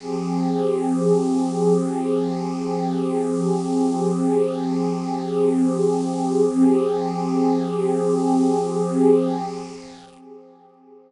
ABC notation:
X:1
M:4/4
L:1/8
Q:1/4=74
K:Fm
V:1 name="Pad 2 (warm)"
[F,CGA]8- | [F,CGA]8 | [F,CGA]8 |]